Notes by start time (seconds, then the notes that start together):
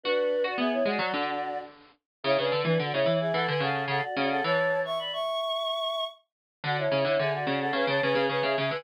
0.04 D4 F#4 B4
0.44 F#4 D5
0.58 B3 G#4 E5
0.72 E4 C#5
0.85 G#3 F#4 D5
0.99 F#3
1.13 D3
2.24 C#3 E4 C#5
2.38 C#3 D4 B4
2.51 D3
2.64 E3 D4 B4
2.79 D3 F#4 D5
2.93 C#3 E4 C#5
3.05 E3
3.20 G#4 E5
3.34 E3 A4 F#5
3.48 D3 B4 G#5
3.60 C#3 A4 F#5
3.88 C#3 A4 F#5
4.03 F#4 D5
4.16 C#3 F#4 D5
4.30 A4 F#5
4.44 E3 C#5 A5
4.85 E5 C#6
4.99 D5 B5
5.13 E5 C#6
6.64 D3 F#4 D5
6.78 E4 C#5
6.91 C#3
7.04 D3 E4 C#5
7.19 D3 G#4 E5
7.33 F#4 D5
7.47 C#3
7.60 A4 F#5
7.72 C#3 B4 G#5
7.87 C#3 C#5 A5
8.02 C#3 B4 G#5
8.15 C#3
8.29 C#3 B4 G#5
8.43 C#3 G#4 E5
8.57 C#3 G#4 E5
8.71 D3 B4 G#5